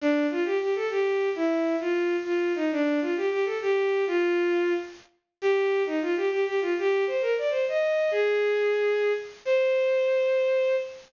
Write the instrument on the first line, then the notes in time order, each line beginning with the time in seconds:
violin
0.01 D4
0.31 F4
0.45 G4
0.61 G4
0.75 A4
0.90 G4
1.36 E4
1.80 F4
2.25 F4
2.55 D#4
2.72 D4
3.01 F4
3.17 G4
3.31 G4
3.45 A4
3.62 G4
4.07 F4
5.42 G4
5.86 D#4
6.01 F4
6.17 G4
6.31 G4
6.46 G4
6.61 F4
6.79 G4
7.07 C5
7.21 A#4
7.38 D5
7.50 C5
7.68 D#5
8.11 G#4
9.45 C5